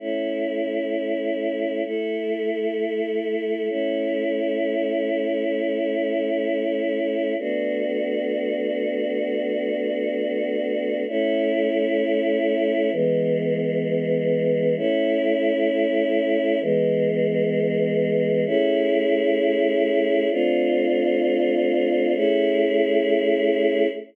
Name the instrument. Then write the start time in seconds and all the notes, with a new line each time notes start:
choir aahs
0.00 A3 C#4 E4
1.85 A3 E4 A4
3.69 A3 C#4 E4
7.39 A3 B3 D4 F#4
11.08 A3 C#4 E4
12.92 E3 G#3 B3
14.77 A3 C#4 E4
16.62 E3 G#3 B3
18.46 A3 C#4 E4 G#4
20.31 A3 C4 D4 F4
22.15 A3 C#4 E4 G#4